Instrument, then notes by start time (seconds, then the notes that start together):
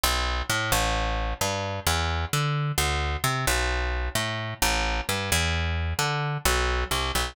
electric bass (finger)
0.04 B1
0.50 A2
0.72 A1
1.41 G2
1.87 E2
2.33 D3
2.78 D2
3.24 C3
3.47 B1
4.15 A2
4.62 A1
5.09 G2
5.32 E2
5.99 D3
6.45 B1
6.91 C2
7.15 B1